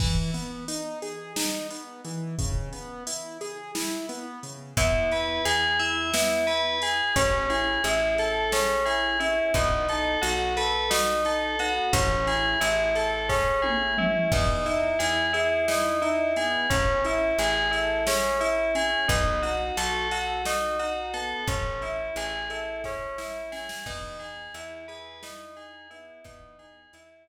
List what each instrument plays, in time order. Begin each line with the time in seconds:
0.00 acoustic grand piano E3, kick, crash
0.34 acoustic grand piano B3, closed hi-hat
0.68 acoustic grand piano D#4, closed hi-hat
1.02 acoustic grand piano G#4, closed hi-hat
1.36 acoustic grand piano D#4, snare
1.70 acoustic grand piano B3, closed hi-hat
2.05 acoustic grand piano E3, closed hi-hat
2.38 acoustic grand piano C#3, kick, closed hi-hat
2.73 acoustic grand piano B3, closed hi-hat
3.07 acoustic grand piano E4, closed hi-hat
3.41 acoustic grand piano G#4, closed hi-hat
3.75 acoustic grand piano E4, snare
4.09 acoustic grand piano B3, closed hi-hat
4.43 acoustic grand piano C#3, closed hi-hat
4.77 electric bass (finger) E2, acoustic grand piano B3, tubular bells E4, kick, closed hi-hat
5.11 acoustic grand piano E4, tubular bells B4, closed hi-hat
5.45 electric bass (finger) E2, tubular bells G#4, acoustic grand piano G#4, closed hi-hat
5.79 acoustic grand piano E4, tubular bells E5, closed hi-hat
6.14 acoustic grand piano B3, tubular bells E4, snare
6.47 acoustic grand piano E4, tubular bells B4, closed hi-hat
6.82 acoustic grand piano G#4, tubular bells G#4, closed hi-hat
7.16 electric bass (finger) A1, acoustic grand piano C#4, tubular bells C#4, kick, closed hi-hat
7.50 acoustic grand piano E4, tubular bells G#4, closed hi-hat
7.84 electric bass (finger) A1, tubular bells E4, acoustic grand piano G#4, closed hi-hat
8.18 acoustic grand piano A4, tubular bells A4, closed hi-hat
8.52 tubular bells C#4, acoustic grand piano G#4, snare
8.85 acoustic grand piano E4, tubular bells G#4, closed hi-hat
9.20 acoustic grand piano C#4, tubular bells E4, closed hi-hat
9.54 electric bass (finger) B1, acoustic grand piano B3, tubular bells D#4, kick, closed hi-hat
9.88 acoustic grand piano D#4, tubular bells A4, closed hi-hat
10.22 electric bass (finger) B1, tubular bells F#4, acoustic grand piano F#4, closed hi-hat
10.57 acoustic grand piano A4, tubular bells B4, closed hi-hat
10.90 tubular bells D#4, acoustic grand piano F#4, snare
11.25 acoustic grand piano D#4, tubular bells A4, closed hi-hat
11.59 acoustic grand piano B3, tubular bells F#4, closed hi-hat
11.93 electric bass (finger) A1, acoustic grand piano C#4, tubular bells C#4, kick, closed hi-hat
12.27 acoustic grand piano E4, tubular bells G#4, closed hi-hat
12.61 electric bass (finger) A1, tubular bells E4, acoustic grand piano G#4, closed hi-hat
12.95 acoustic grand piano A4, tubular bells A4, closed hi-hat
13.29 tubular bells C#4, acoustic grand piano G#4, kick, snare
13.62 acoustic grand piano E4, tubular bells G#4, high tom
13.98 acoustic grand piano C#4, tubular bells E4, mid tom
14.32 electric bass (finger) E2, acoustic grand piano B3, tubular bells D#4, kick, crash
14.66 acoustic grand piano D#4, tubular bells E4, closed hi-hat
14.99 electric bass (finger) E2, acoustic grand piano E4, tubular bells G#4, closed hi-hat
15.33 tubular bells E4, acoustic grand piano G#4, closed hi-hat
15.68 tubular bells D#4, acoustic grand piano E4, snare
16.02 acoustic grand piano D#4, tubular bells E4, closed hi-hat
16.36 acoustic grand piano B3, tubular bells G#4, closed hi-hat
16.70 electric bass (finger) A1, tubular bells C#4, acoustic grand piano C#4, kick, closed hi-hat
17.05 acoustic grand piano E4, tubular bells E4, closed hi-hat
17.38 electric bass (finger) A1, acoustic grand piano G#4, tubular bells G#4, closed hi-hat
17.71 tubular bells E4, acoustic grand piano A4, closed hi-hat
18.07 tubular bells C#4, acoustic grand piano G#4, snare
18.40 tubular bells E4, acoustic grand piano E4, closed hi-hat
18.75 acoustic grand piano C#4, tubular bells G#4, closed hi-hat
19.08 electric bass (finger) B1, acoustic grand piano B3, tubular bells D#4, kick, closed hi-hat
19.42 acoustic grand piano D#4, tubular bells F#4, closed hi-hat
19.77 electric bass (finger) B1, acoustic grand piano F#4, tubular bells A4, closed hi-hat
20.11 tubular bells F#4, acoustic grand piano A4, closed hi-hat
20.45 tubular bells D#4, acoustic grand piano F#4, snare
20.79 acoustic grand piano D#4, tubular bells F#4, closed hi-hat
21.14 acoustic grand piano B3, tubular bells A4, closed hi-hat
21.47 electric bass (finger) A1, acoustic grand piano C#4, tubular bells C#4, kick, closed hi-hat
21.82 acoustic grand piano E4, tubular bells E4, closed hi-hat
22.16 electric bass (finger) A1, acoustic grand piano G#4, tubular bells G#4, closed hi-hat
22.50 tubular bells E4, acoustic grand piano A4, closed hi-hat
22.84 tubular bells C#4, acoustic grand piano G#4, kick, snare
23.18 acoustic grand piano E4, tubular bells E4, snare
23.52 acoustic grand piano C#4, tubular bells G#4, snare
23.69 snare
23.86 electric bass (finger) E2, acoustic grand piano B3, tubular bells D#4, kick, crash
24.19 acoustic grand piano D#4, tubular bells G#4, closed hi-hat
24.54 electric bass (finger) E2, tubular bells E4, acoustic grand piano E4, closed hi-hat
24.88 acoustic grand piano G#4, tubular bells B4, closed hi-hat
25.23 tubular bells D#4, acoustic grand piano E4, snare
25.57 acoustic grand piano D#4, tubular bells G#4, closed hi-hat
25.90 acoustic grand piano B3, tubular bells E4, closed hi-hat
26.24 electric bass (finger) E2, acoustic grand piano B3, tubular bells D#4, kick, closed hi-hat
26.59 acoustic grand piano D#4, tubular bells G#4, closed hi-hat
26.93 electric bass (finger) E2, acoustic grand piano E4, tubular bells E4, closed hi-hat
27.27 acoustic grand piano G#4, tubular bells B4, closed hi-hat